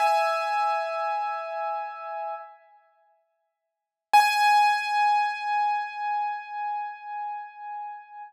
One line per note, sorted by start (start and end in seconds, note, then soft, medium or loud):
0.00 2.34 E5 medium
0.00 2.34 G#5 medium
4.13 8.22 G#5 loud